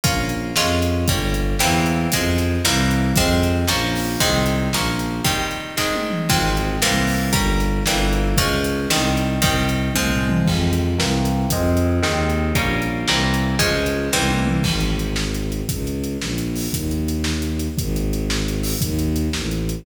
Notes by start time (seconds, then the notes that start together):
0.04 A#1 A#3 C#4 F4, kick, closed hi-hat
0.29 closed hi-hat
0.56 F2 G#3 C#4 F4, snare
0.82 closed hi-hat
1.07 G1 G3 A#3 C#4, kick, closed hi-hat
1.34 closed hi-hat
1.58 E2 E3 G3 A#3 C4, snare
1.86 closed hi-hat
2.10 F2 F3 G#3 C4, kick, closed hi-hat
2.38 closed hi-hat
2.64 C2 E3 G3 A#3 C4, snare
2.91 closed hi-hat
3.16 F2 F3 G#3 C4, kick, closed hi-hat
3.43 closed hi-hat
3.67 A#1 F3 A#3 C#4, snare
3.95 open hi-hat
4.20 C2 D#3 G#3 C4, kick, closed hi-hat
4.46 closed hi-hat
4.73 A#1 F3 A#3 C#4, snare
4.99 closed hi-hat
5.24 D#3 G3 C4, kick, closed hi-hat
5.51 closed hi-hat
5.77 D#3 G#3 C4, kick, snare
5.95 high tom
6.11 mid tom
6.29 G#1 F3 G#3 C4, kick, crash
6.57 closed hi-hat
6.82 C2 E3 G3 A#3 C4, snare
7.07 open hi-hat
7.33 G1 G3 A#3 C#4, kick, closed hi-hat
7.60 closed hi-hat
7.86 G1 E3 G3 A#3 C4, snare
8.13 closed hi-hat
8.37 C#2 F3 G#3 C#4, kick, closed hi-hat
8.64 closed hi-hat
8.90 C2 D#3 G3 C4, snare
9.17 closed hi-hat
9.41 C2 D#3 G3 C4, kick, closed hi-hat
9.69 closed hi-hat
9.94 C2 F3 G#3 C4, kick, high tom
10.11 floor tom
10.29 mid tom
10.45 F2 F3 G#3 C4, kick, crash
10.73 closed hi-hat
10.97 C2 E3 G3 A#3 C4, snare
11.25 closed hi-hat
11.50 F2 F3 G#3 C4, kick, closed hi-hat
11.77 closed hi-hat
12.02 D#2 D#3 G#3 C4, snare
12.30 closed hi-hat
12.55 A#1 G3 A#3 C#4, kick, closed hi-hat
12.82 closed hi-hat
13.07 C2 E3 G3 A#3 C4, snare
13.34 closed hi-hat
13.59 C#2 F3 G#3 C#4, kick, closed hi-hat
13.86 closed hi-hat
14.12 C2 E3 G3 A#3 C4, kick, snare
14.31 high tom
14.47 mid tom
14.63 G#1, kick, crash
14.80 closed hi-hat
14.99 closed hi-hat
15.16 snare
15.34 closed hi-hat
15.52 closed hi-hat
15.69 C#2, kick, closed hi-hat
15.87 closed hi-hat
16.04 closed hi-hat
16.20 A#1, snare
16.38 closed hi-hat
16.56 open hi-hat
16.72 D#2, kick, closed hi-hat
16.91 closed hi-hat
17.08 closed hi-hat
17.24 snare
17.42 closed hi-hat
17.59 closed hi-hat
17.78 G#1, kick, closed hi-hat
17.96 closed hi-hat
18.13 closed hi-hat
18.30 snare
18.48 closed hi-hat
18.63 open hi-hat
18.81 D#2, kick, closed hi-hat
18.99 closed hi-hat
19.16 closed hi-hat
19.33 A1, snare
19.51 closed hi-hat
19.69 closed hi-hat